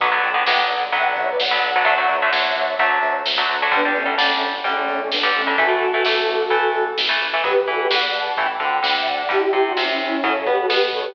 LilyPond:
<<
  \new Staff \with { instrumentName = "Lead 2 (sawtooth)" } { \time 4/4 \key b \minor \tempo 4 = 129 <b'' d'''>16 <b'' d'''>16 <g'' b''>8 <e'' g''>16 <d'' fis''>16 r8 <e'' g''>16 <d'' fis''>16 <cis'' e''>16 <b' d''>16 <d'' fis''>8 <d'' fis''>8 | <d'' fis''>8 <cis'' e''>2~ <cis'' e''>8 r4 | <b d'>16 <b d'>16 <a cis'>8 <a cis'>16 <a cis'>16 r8 <a cis'>16 <a cis'>16 <a cis'>16 <a cis'>16 <b d'>8 <a cis'>8 | <fis' a'>2. r4 |
<g' b'>8 <fis' a'>16 <g' b'>16 <d'' fis''>8 <fis'' a''>8 <g'' b''>16 <b'' d'''>16 <g'' b''>8 <g'' b''>16 <e'' g''>16 <d'' fis''>8 | <e' g'>16 <e' g'>8 <d' fis'>16 <cis' e'>16 <cis' e'>16 <cis' e'>8 <a' cis''>8 <g' b'>16 <fis' a'>16 <g' b'>16 r16 <a' cis''>16 <g' b'>16 | }
  \new Staff \with { instrumentName = "Overdriven Guitar" } { \time 4/4 \key b \minor <d fis b>16 <d fis b>8 <d fis b>16 <d fis b>4 <d fis b>4~ <d fis b>16 <d fis b>8 <d fis b>16 | <d fis a>16 <d fis a>8 <d fis a>16 <d fis a>4 <d fis a>4~ <d fis a>16 <d fis a>8 <d fis a>16 | <d g>16 <d g>8 <d g>16 <d g>4 <d g>4~ <d g>16 <d g>8 <d g>16 | <e a>16 <e a>8 <e a>16 <e a>4 <e a>4~ <e a>16 <e a>8 <e a>16 |
<fis b>8 e8 e4 <e a>8 d8 d4 | <d g>8 c8 c4 <cis fis>8 b8 b4 | }
  \new Staff \with { instrumentName = "Synth Bass 1" } { \clef bass \time 4/4 \key b \minor b,,8 b,,8 b,,8 b,,8 b,,8 b,,8 b,,8 b,,8 | d,8 d,8 d,8 d,8 d,8 d,8 d,8 d,8 | g,,8 g,,8 g,,8 g,,8 g,,8 g,,8 g,,8 g,,8 | a,,8 a,,8 a,,8 a,,8 a,,8 a,,8 a,,8 a,,8 |
b,,8 e,8 e,4 a,,8 d,8 d,4 | g,,8 c,8 c,4 fis,8 b,8 b,4 | }
  \new DrumStaff \with { instrumentName = "Drums" } \drummode { \time 4/4 <hh bd>8 hh8 sn8 hh8 <hh bd>8 <hh bd>8 sn8 hh8 | <hh bd>8 <hh bd>8 sn8 hh8 <hh bd>8 hh8 sn8 hh8 | <hh bd>8 <hh bd>8 sn8 hh8 <hh bd>8 <hh bd>8 sn8 hh8 | <hh bd>8 <hh bd>8 sn8 hh8 <hh bd>8 hh8 sn8 hh8 |
<hh bd>8 hh8 sn8 hh8 <hh bd>8 <hh bd>8 sn8 <hh bd>8 | <hh bd>8 <hh bd>8 sn8 hh8 <hh bd>8 <hh bd>8 sn8 <hho bd>8 | }
>>